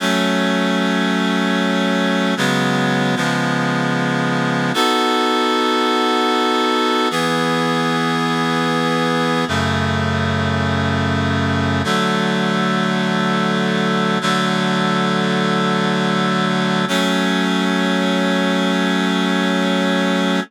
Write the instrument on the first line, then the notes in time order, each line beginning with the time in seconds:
clarinet
0.00 F#3 A3 C#4
2.37 C#3 F#3 G#3 B3
3.16 C#3 F3 G#3 B3
4.74 B3 D#4 F#4 A4
7.11 E3 B3 G#4
9.48 F#2 C#3 A3
11.84 D3 F#3 A3
14.21 D3 F#3 A3
16.88 F#3 A3 C#4